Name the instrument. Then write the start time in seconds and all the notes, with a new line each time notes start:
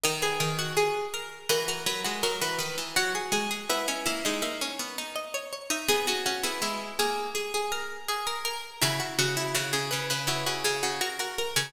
harpsichord
0.04 D#3 A#4 D#5
0.22 G#4 B4
0.40 D#3 A#4
0.59 F#4
0.77 G#4
1.14 A#4
1.49 E3 F#4 A#4
1.68 F#4 A#4
1.86 F#3 B4
2.04 G#3 F#4
2.23 F#3 F#4 A#4
2.41 E3 F#4 B4
2.59 D#3 B4
2.78 E3
2.96 F#3 F#4
3.15 G#4
3.32 G#3 G#4
3.51 G#4
3.70 B3 E4 B4
3.88 C#4 D#5
4.06 A#3 E4 E5
4.25 G#3 D#4
4.42 A#3 E5
4.61 C#4
4.79 B3
4.98 D#4
5.16 D#5
5.34 C#5
5.53 C#5
5.70 D#4 E5
5.88 B3 G#4
6.07 C#4 F#4
6.26 C#4 F#4
6.43 B3 E4 G#4
6.62 G#3 E4
6.99 A#3 G#4
7.35 G#4
7.54 G#4
7.72 A#4
8.09 G#4
8.27 A#4
8.45 A#4
8.82 C#3 E4 F#4
9.00 F#4
9.19 C#3 F#4
9.37 E4
9.55 C#3 F#4
9.73 C#3 G#4
9.91 C#3 B4
10.10 C#3 B4
10.27 C#3 E4 F#4
10.46 C#3 F#4
10.64 C#3 G#4
10.83 C#3 F#4
11.01 F#4 A#4
11.19 F#4 A#4
11.38 A#4
11.56 C#3 C#5